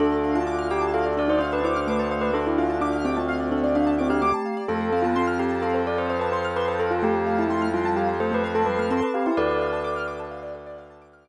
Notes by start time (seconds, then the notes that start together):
0.00 D2 D4 A4
0.12 D5
0.24 F5
0.35 F4 A5
0.47 F4 D6
0.59 F6
0.70 G4 D6
0.81 F4 A5
0.94 A4 F5
1.05 D5
1.17 D4 A4 D5
1.28 D#4 C5 D5
1.39 D4 C5 F5
1.52 B4 A5
1.63 E4 C5 D6
1.76 D4 F6
1.87 A3 B4 D6
1.99 C5 A5
2.11 C5 F5
2.21 B4 D5
2.33 D4 A4
2.46 E4 D5
2.58 F4 F5
2.70 A5
2.81 D4 F4 D6
2.93 F6
3.05 C4 G4 D6
3.15 C4 F4 A5
3.28 F5
3.40 D5
3.51 C4 D4 A4
3.63 D4 D5
3.75 D4 F5
3.87 A5
3.98 C4 E4 D6
4.10 D4 G4 F6
4.22 A3 D6
4.34 A5
4.46 F5
4.57 D5
4.68 F2 A3 A4
4.81 C5
4.92 C4 F5
5.02 B3 F4 A5
5.16 C4 C6
5.27 F6
5.39 G4 C6
5.51 A5
5.62 C4 A4 F5
5.74 C5
5.86 A4 D5
5.98 C5
6.09 C5 F5
6.19 B4 A5
6.32 C5 C6
6.45 F6
6.56 B4 C6
6.68 C5 A5
6.79 A4 F5
6.91 F4 C5
7.03 A3 G4 A4
7.15 C5
7.27 F5
7.38 E4 A5
7.50 A3 C6
7.62 F6
7.74 G3 F4 C6
7.84 G3 A5
7.96 G4 F5
8.08 C5
8.20 A3 A4 C5
8.32 A3 B4 C5
8.43 A3 B4 F5
8.55 A4 A5
8.66 G3 B4 C6
8.78 A3 F6
8.90 C4 A4 C6
9.02 B4 A5
9.14 G4 F5
9.26 E4 C5
9.37 D2 A4 B4 D5
9.49 A4 D5
9.61 F5
9.73 A5
9.84 D6
9.96 F6
10.08 D6
10.19 A5
10.31 F5
10.43 D5
10.55 A4
10.66 D5
10.78 F5
10.90 A5
11.02 D6
11.13 F6
11.25 D6